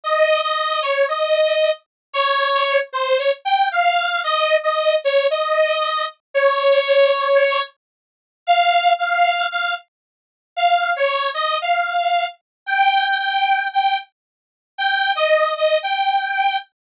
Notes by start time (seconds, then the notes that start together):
0.04 D#5
0.43 D#5
0.82 C#5
1.08 D#5
2.13 C#5
2.93 C5
3.19 C#5
3.45 G5
3.72 F5
4.24 D#5
4.63 D#5
5.04 C#5
5.30 D#5
6.34 C#5
8.47 F5
8.99 F5
9.51 F5
10.56 F5
10.96 C#5
11.34 D#5
11.62 F5
12.66 G5
13.18 G5
13.73 G5
14.78 G5
15.15 D#5
15.57 D#5
15.83 G5